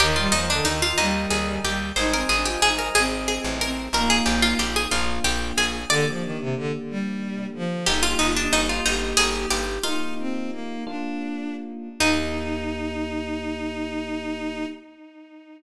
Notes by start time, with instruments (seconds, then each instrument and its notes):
0.00 electric bass (finger) D#2, violin D#3, harpsichord G4, electric piano 1 A#4 D#5 G5
0.16 violin G3, harpsichord F4
0.32 electric bass (finger) D#2, violin F3, harpsichord D#4
0.49 violin D3, harpsichord D4
0.65 electric bass (finger) D#2, violin D#3, harpsichord D#4
0.82 harpsichord F4
0.98 electric bass (finger) D#2, violin G3, harpsichord D#4
1.30 electric bass (finger) D#2, harpsichord G#4
1.63 electric bass (finger) D#2, violin G3, harpsichord G4
1.96 electric bass (finger) G#1, violin D#4, harpsichord C5, electric piano 1 C5 D#5 G#5
2.12 violin C4, harpsichord A#4
2.29 electric bass (finger) G#1, violin D4, harpsichord G#4
2.45 violin F4, harpsichord G4
2.62 electric bass (finger) G#1, violin D#4, harpsichord G#4
2.79 harpsichord A#4
2.95 electric bass (finger) G#1, violin C4, harpsichord G#4
3.28 harpsichord G#4
3.44 electric bass (finger) A1
3.61 violin C4, harpsichord A#4
3.93 electric bass (finger) A#1, electric piano 1 A#3 D#4 F4, violin A#3, harpsichord A#4
4.10 harpsichord G#4
4.26 electric bass (finger) A#1, harpsichord G4
4.42 harpsichord F4
4.59 electric bass (finger) A#1, harpsichord G4
4.76 harpsichord G#4
4.91 electric bass (finger) A#1, electric piano 1 A#3 D4 F4, harpsichord F4
5.24 electric bass (finger) A#1, harpsichord G4
5.57 electric bass (finger) A#1, harpsichord G#4
5.89 violin D3, electric piano 1 A#3 D4 G4, harpsichord D5
6.07 violin F3
6.22 violin D#3
6.39 violin C3
6.56 violin D3
6.88 violin G3
7.54 violin F3
7.86 electric bass (finger) G1, electric piano 1 A#3 D#4 G4, violin D#4, harpsichord G4
8.02 harpsichord F4, violin G4
8.19 electric bass (finger) G1, harpsichord D#4, violin F4
8.36 harpsichord D4, violin D4
8.53 electric bass (finger) G1, violin D#4, harpsichord D#4
8.69 harpsichord F4
8.84 electric bass (finger) G1, harpsichord D#4, violin G4
9.17 electric bass (finger) G1, harpsichord G#4
9.51 electric bass (finger) G1, harpsichord G4, violin G4
9.83 electric piano 1 A#3 D#4 F4, violin D#4, harpsichord F4
10.18 violin C4
10.50 violin A#3
10.86 electric piano 1 A#3 D4 F4, violin D4
12.00 electric bass (finger) D#2, electric piano 1 A#3 D#4 G4, harpsichord D#4, violin D#4